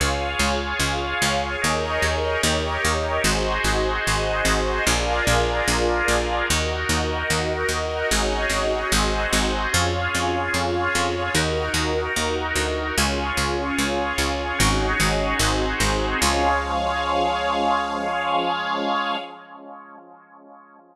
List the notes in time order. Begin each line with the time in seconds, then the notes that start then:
0.00 C#2 F4 G#4 C#5 F5
0.39 C#2
0.80 C#2
1.22 C#2
1.62 D#2 D#4 G#4 A#4 C#5 D#5
2.02 D#2
2.43 D#2 D#4 G4 A#4 C#5 D#5
2.85 D#2
3.23 G#1 D#4 F#4 G#4 C5 D#5
3.64 G#1
4.07 G#1
4.45 G#1
4.86 A#1 D4 F4 G#4 A#4 D5
5.27 A#1
5.68 A#1
6.08 A#1
6.49 D#2 D#4 F#4 A#4 D#5
6.89 D#2
7.30 D#2
7.69 D#2
8.11 G#1 C#4 D#4 F#4 G#4 C#5 D#5
8.49 G#1
8.92 G#1 C4 D#4 F#4 G#4 C5 D#5
9.33 G#1
9.72 F2 C#4 F4 G#4 C#5
10.15 F2
10.54 F2
10.95 F2
11.35 D#2 D#4 F#4 A#4
11.74 D#2
12.16 D#2
12.56 D2
12.97 C#2 C#4 F4 G#4 C#5
13.37 C#2
13.79 C#2
14.18 C#2
14.59 G#1 C#4 D#4 F#4 G#4 C#5
15.00 G#1
15.39 G#1 C4 D#4 F#4 G#4 C5
15.80 G#1
16.21 C#2 F3 G#3 C#4 G#4 C#5 F5